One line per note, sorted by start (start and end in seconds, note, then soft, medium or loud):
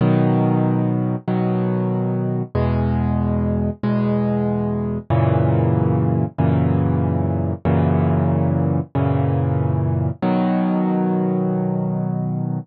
0.01 1.16 B2 loud
0.01 1.16 D#3 loud
0.01 1.16 F#3 medium
1.28 2.43 B2 medium
1.28 2.43 D#3 medium
1.28 2.43 F#3 medium
2.55 3.70 E2 loud
2.55 3.70 B2 loud
2.55 3.70 G#3 medium
3.83 4.98 E2 medium
3.83 4.98 B2 medium
3.83 4.98 G#3 medium
5.10 6.25 F#2 loud
5.10 6.25 A#2 loud
5.10 6.25 C#3 loud
5.10 6.25 E3 loud
6.38 7.53 F#2 medium
6.38 7.53 A#2 medium
6.38 7.53 C#3 medium
6.38 7.53 E3 medium
7.65 8.80 F#2 loud
7.65 8.80 A#2 loud
7.65 8.80 C#3 loud
7.65 8.80 E3 medium
8.95 10.10 F#2 medium
8.95 10.10 A#2 medium
8.95 10.10 C#3 medium
8.95 10.10 E3 medium
10.22 12.59 B2 loud
10.22 12.59 D#3 loud
10.22 12.59 F#3 loud